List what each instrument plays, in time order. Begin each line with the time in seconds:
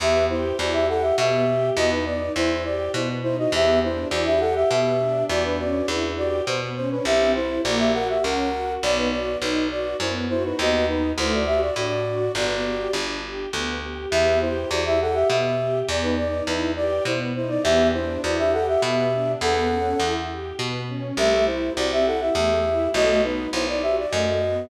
0.00 electric bass (finger) E2, string ensemble 1 B3, flute G4 E5
0.29 flute E4 C5, string ensemble 1 G4
0.58 electric bass (finger) E2, string ensemble 1 E4, flute F#4 D5
0.73 flute G4 E5
0.88 string ensemble 1 G4, flute A4 F#5
1.02 flute G4 E5
1.17 electric bass (finger) B2, string ensemble 1 B3, flute G4 E5
1.47 string ensemble 1 G4
1.76 electric bass (finger) E2, string ensemble 1 B3, flute F#4 D#5
1.91 flute D#4 B4
2.06 string ensemble 1 D#4, flute D5
2.35 electric bass (finger) E2, string ensemble 1 E4, flute E4 C5
2.64 string ensemble 1 G4, flute D5
2.94 electric bass (finger) B2, string ensemble 1 B3, flute E4 C5
3.23 string ensemble 1 D#4, flute E4 C5
3.38 flute F#4 D#5
3.52 electric bass (finger) E2, string ensemble 1 B3, flute G4 E5
3.83 string ensemble 1 D4, flute E4 C5
4.11 electric bass (finger) E2, string ensemble 1 E4, flute F#4 D5
4.26 flute G4 E5
4.40 string ensemble 1 G4, flute A4 F#5
4.55 flute G4 E5
4.70 electric bass (finger) B2, string ensemble 1 B3, flute G4 E5
5.00 string ensemble 1 D4
5.29 electric bass (finger) E2, string ensemble 1 B3, flute F#4 D5
5.45 flute D4 B4
5.59 string ensemble 1 C#4, flute F#4 D5
5.88 electric bass (finger) E2, flute D4 B4, string ensemble 1 E4
6.17 flute F#4 D5, string ensemble 1 G4
6.47 electric bass (finger) B2, string ensemble 1 B3, flute C5
6.76 string ensemble 1 C#4, flute C5
6.91 flute D4 B4
7.05 electric bass (finger) C2, string ensemble 1 C4, flute G4 E5
7.35 flute E4 C5, string ensemble 1 E4
7.64 electric bass (finger) A#1, string ensemble 1 A#3, flute F#4 D5
7.79 flute G4 E5
7.94 string ensemble 1 F#4, flute A#4 F#5
8.09 flute G4 E5
8.23 electric bass (finger) C#2, string ensemble 1 C#4, flute A#4 F#5
8.53 string ensemble 1 F#4
8.82 electric bass (finger) B1, string ensemble 1 B3, flute D5
8.97 flute D#4 B4
9.11 string ensemble 1 F#4, flute D5
9.41 electric bass (finger) B1, flute D#4 B4, string ensemble 1 D#4
9.70 string ensemble 1 F#4, flute D5
10.00 electric bass (finger) F#2, string ensemble 1 B3, flute E4 C5
10.29 flute E4 C5, string ensemble 1 F#4
10.44 flute D#4 B4
10.58 electric bass (finger) D#2, string ensemble 1 B3, flute F#4 D#5
10.87 flute D#4 B4, string ensemble 1 D#4
11.18 electric bass (finger) D2, string ensemble 1 A3, flute E4 C5
11.34 flute F#4 D5
11.46 string ensemble 1 F#4, flute G4 E5
11.60 flute F#4 D5
11.76 electric bass (finger) A2, string ensemble 1 D4, flute F#4 D5
12.06 string ensemble 1 F#4
12.35 electric bass (finger) G1, string ensemble 1 B3, flute F#4 D5
12.65 string ensemble 1 G4
12.93 electric bass (finger) G1, string ensemble 1 D4
13.24 string ensemble 1 G4
13.53 electric bass (finger) D2, string ensemble 1 B3
13.82 string ensemble 1 G4
14.11 electric bass (finger) E2, string ensemble 1 B3, flute G4 E5
14.41 flute E4 C5, string ensemble 1 G4
14.70 electric bass (finger) E2, string ensemble 1 E4, flute F#4 D5
14.86 flute G4 E5
15.00 string ensemble 1 G4, flute A4 F#5
15.14 flute G4 E5
15.29 electric bass (finger) B2, string ensemble 1 B3, flute G4 E5
15.59 string ensemble 1 G4
15.88 electric bass (finger) E2, string ensemble 1 B3, flute D5
16.03 flute D#4 B4
16.17 string ensemble 1 D#4, flute D5
16.46 electric bass (finger) E2, flute D#4 B4, string ensemble 1 E4
16.76 string ensemble 1 G4, flute D5
17.05 electric bass (finger) B2, string ensemble 1 B3, flute E4 C5
17.35 string ensemble 1 D#4, flute E4 C5
17.49 flute D5
17.63 electric bass (finger) E2, string ensemble 1 B3, flute G4 E5
17.93 string ensemble 1 D4, flute E4 C5
18.23 electric bass (finger) E2, string ensemble 1 E4, flute F#4 D5
18.38 flute G4 E5
18.53 string ensemble 1 G4, flute A4 F#5
18.68 flute G4 E5
18.82 electric bass (finger) B2, string ensemble 1 B3, flute G4 E5
19.12 string ensemble 1 D4
19.41 electric bass (finger) E2, string ensemble 1 B3, flute A4 F#5
19.70 string ensemble 1 C#4
20.00 electric bass (finger) E2, string ensemble 1 E4
20.29 string ensemble 1 G4
20.59 electric bass (finger) B2, string ensemble 1 B3
20.88 string ensemble 1 C#4
21.17 electric bass (finger) C2, string ensemble 1 A3, flute G4 E5
21.46 flute E4 C5, string ensemble 1 E4
21.76 electric bass (finger) C2, string ensemble 1 C4, flute F#4 D5
21.92 flute G4 E5
22.06 string ensemble 1 E4, flute A4 F#5
22.21 flute G4 E5
22.35 electric bass (finger) E2, string ensemble 1 A3, flute G4 E5
22.65 string ensemble 1 E4
22.94 electric bass (finger) B1, string ensemble 1 A3, flute F#4 D#5
23.23 string ensemble 1 B3, flute D#4 B4
23.53 electric bass (finger) B1, string ensemble 1 D#4, flute E4 C5
23.68 flute D5
23.82 string ensemble 1 F#4, flute G4 E5
23.98 flute D5
24.11 electric bass (finger) F#2, string ensemble 1 A3, flute F#4 D#5
24.42 string ensemble 1 B3